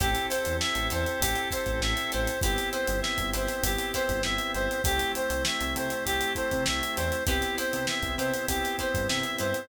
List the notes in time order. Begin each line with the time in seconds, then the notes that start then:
0.00 A1 C4 E4 G4 A4 C5, kick, closed hi-hat
0.15 closed hi-hat
0.29 E4 G4 A4 C5, snare, closed hi-hat
0.45 E2, closed hi-hat
0.60 E5, snare
0.75 A1, closed hi-hat
0.90 E2 E4 G4 A4 C5, snare, closed hi-hat
1.06 closed hi-hat
1.20 A1 G4, kick, closed hi-hat
1.35 closed hi-hat
1.51 E4 G4 A4 C5, kick, closed hi-hat
1.66 A1, kick, closed hi-hat
1.81 A1 E5, snare
1.97 snare, closed hi-hat
2.12 A1 E4 G4 A4 C5, snare, closed hi-hat
2.27 closed hi-hat
2.41 G1 B3 C4 E4 G4 B4 C5, kick, closed hi-hat
2.56 snare, closed hi-hat
2.72 E4 G4 B4 C5, closed hi-hat
2.87 G1, closed hi-hat
3.02 E5, snare
3.18 G1, kick, closed hi-hat
3.33 G1 E4 G4 B4 C5, closed hi-hat
3.47 snare, closed hi-hat
3.63 G1 G4, kick, closed hi-hat
3.78 closed hi-hat
3.93 E4 G4 B4 C5, kick, snare, closed hi-hat
4.09 G1, kick, closed hi-hat
4.23 G1 E5, snare
4.38 closed hi-hat
4.54 G1 E4 G4 B4 C5, snare, closed hi-hat
4.71 closed hi-hat
4.84 C2 A3 C4 E4 G4 A4 C5, kick, closed hi-hat
4.99 closed hi-hat
5.15 E4 G4 A4 C5, closed hi-hat
5.30 C2, closed hi-hat
5.45 E5, snare
5.61 C2, closed hi-hat
5.76 C3 E4 G4 A4 C5, closed hi-hat
5.90 closed hi-hat
6.05 C2 G4, kick, closed hi-hat
6.21 closed hi-hat
6.35 E4 G4 A4 C5, kick, closed hi-hat
6.51 C3, kick, closed hi-hat
6.66 C2 E5, snare
6.83 closed hi-hat
6.96 E2 E4 G4 A4 C5, closed hi-hat
7.12 closed hi-hat
7.27 C2 B3 C4 E4 G4 B4 C5, kick, closed hi-hat
7.42 snare, closed hi-hat
7.58 E4 G4 B4 C5, closed hi-hat
7.73 C3, closed hi-hat
7.87 E5, snare
8.02 C2, kick, closed hi-hat
8.18 C3 E4 G4 B4 C5, closed hi-hat
8.34 closed hi-hat
8.48 C2 G4, kick, closed hi-hat
8.64 snare, closed hi-hat
8.79 E4 G4 B4 C5, kick, closed hi-hat
8.94 G2, kick, closed hi-hat
9.08 C3 E5, snare
9.23 closed hi-hat
9.39 G2 E4 G4 B4 C5, closed hi-hat
9.54 closed hi-hat